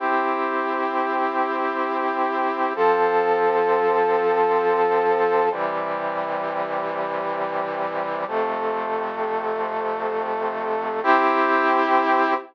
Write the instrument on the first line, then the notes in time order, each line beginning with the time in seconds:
brass section
0.00 C4 E4 G4
2.76 F3 C4 A4
5.52 C3 E3 G3
8.28 F2 C3 A3
11.03 C4 E4 G4